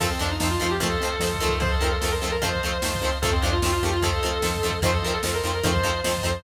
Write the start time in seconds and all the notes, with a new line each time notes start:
0.00 F2 D#3 F3 A3 C4 A4 C5 D#5 F5 A5, kick, crash
0.10 C4
0.19 F2 D#3 F3 A3 C4 D4
0.27 D#4, ride
0.40 F2 D#3 F3 A3 C4 C5 D#5 F5 A5, snare
0.50 F4
0.60 F2 D#3 F3 A3 C4 F4
0.67 G4, ride
0.80 F2 D#3 F3 A3 C4 A4 C5 D#5 F5 A5, kick, ride
1.00 F2 D#3 F3 A3
1.05 C4, ride
1.19 F2 D#3 F3 A3 C5 D#5 F5 A5, snare
1.24 C4
1.34 kick
1.40 F2 D#3 F3 A3 C4
1.48 kick, ride
1.60 F2 C5 D#5 F5 A5, kick, ride
1.71 A4
1.81 F2 D#3 F3 A3 C4 A#4
1.88 A4, ride
2.01 F2 D#3 F3 A3 C5 D#5 F5 A5, snare
2.05 C4
2.11 A#4
2.21 F2 D#3 F3 A3 C4 A4
2.27 ride
2.32 A#4
2.41 F2 D#3 F3 A3 C4 C5 D#5 F5 A5, kick, ride
2.55 kick
2.63 F2 D#3 F3 A3 C4
2.68 ride
2.82 F2 D#3 F3 A3 C5 D#5 F5 A5, snare
2.86 C4
2.95 kick
3.01 F2 D#3 F3 A3 C4
3.08 ride
3.22 F2 D#3 F3 A3 A4 C5 D#5 F5 A5, kick, ride
3.26 C4
3.32 C4
3.42 F2 D#3 F3 A3 C4 D4
3.49 F4, ride
3.62 F2 D#3 F3 A3 C4 C5 D#5 F5 A5, snare
3.72 F4
3.83 F2 D#3 F3 A3 C4 G4
3.89 F4, ride
4.02 D#3 F3 A3 C4 A4 C5 D#5 F5 A5, kick, ride
4.23 F2 D#3 F3 A3 C4
4.29 ride
4.42 F2 D#3 F3 A3 C4 C5 D#5 F5 A5, snare
4.56 kick
4.63 F2 D#3 F3 A3 C4
4.70 kick, ride
4.82 F2 D#3 F3 A3 C5 D#5 F5 A5, kick, ride
4.86 C4
4.93 A4
5.02 F2 D#3 F3 A#4
5.07 A3 C4, ride
5.13 A4
5.23 F2 D#3 F3 A3 C5 D#5 F5 A5, snare
5.27 C4
5.34 A#4
5.44 F2 D#3 F3 A3 C4 A#4
5.51 A#4, ride
5.63 F2 D#3 F3 A3 C4 C5 D#5 F5 A5, kick, ride
5.76 kick
5.83 F2 D#3 F3 A3 C4
5.91 ride
6.04 F2 D#3 F3 A3 C4 C5 D#5 F5 A5, snare
6.17 kick
6.23 F2 D#3 F3 A3 C4
6.32 ride